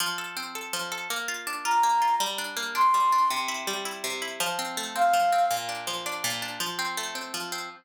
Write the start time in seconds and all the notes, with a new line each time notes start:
0.00 F3
0.18 A4
0.37 C4
0.55 A4
0.73 F3
0.92 A4
1.10 A#3
1.28 F4
1.47 D4
1.65 F4 A#5
1.83 A#3
2.02 F4
2.20 G3
2.38 D4
2.57 A#3
2.75 D4 C6
2.94 G3
3.12 D4
3.30 C3
3.48 E4
3.67 G3
3.85 E4
4.04 C3
4.22 E4
4.40 F3
4.59 C4
4.77 A3
4.96 C4 F5
5.13 F3
5.32 C4
5.51 A#2
5.69 D4
5.87 F3
6.06 D4
6.24 A#2
6.42 D4
6.60 F3
6.79 C4
6.97 A3
7.15 C4
7.34 F3
7.52 C4